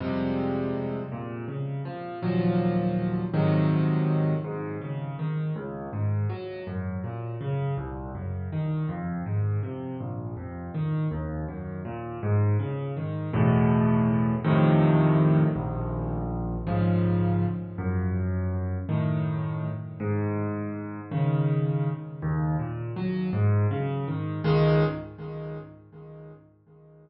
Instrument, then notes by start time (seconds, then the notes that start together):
acoustic grand piano
0.00 F2 C3 G3 G#3
1.12 A#2
1.48 C#3
1.85 F3
2.23 D#2 A#2 F3 F#3
3.34 G#2 C3 D#3 F#3
4.44 G#2
4.81 C#3
5.19 D#3
5.56 C#2
5.93 G#2
6.29 F#3
6.67 F#2
7.04 A#2
7.41 C#3
7.78 C2
8.15 F#2
8.52 D#3
8.89 F2
9.26 G#2
9.63 C3
10.00 A#1
10.37 F2
10.74 D#3
11.11 D#2
11.48 F#2
11.85 A#2
12.23 G#2
12.59 C#3
12.97 D#3
13.33 E2 A2 B2
14.44 F2 A2 C3 D#3
15.56 A#1
16.67 G#2 C#3 F3
17.78 F#2
18.89 A2 D#3
20.00 G#2
21.11 C#3 D#3
22.22 D#2
22.59 A#2
22.96 F#3
23.33 G#2
23.71 C#3
24.08 D#3
24.44 C#2 D#3 G#3